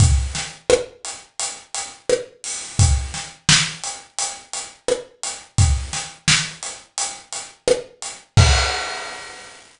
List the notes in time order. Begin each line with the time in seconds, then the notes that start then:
0.00 kick, closed hi-hat
0.35 snare, closed hi-hat
0.70 cross-stick
1.05 closed hi-hat
1.40 closed hi-hat
1.74 closed hi-hat
2.09 cross-stick
2.44 open hi-hat
2.79 kick, closed hi-hat
3.14 snare, closed hi-hat
3.49 snare
3.84 closed hi-hat
4.18 closed hi-hat
4.53 closed hi-hat
4.88 cross-stick
5.23 closed hi-hat
5.58 kick, closed hi-hat
5.93 snare, closed hi-hat
6.28 snare
6.63 closed hi-hat
6.98 closed hi-hat
7.33 closed hi-hat
7.68 cross-stick
8.02 closed hi-hat
8.37 kick, crash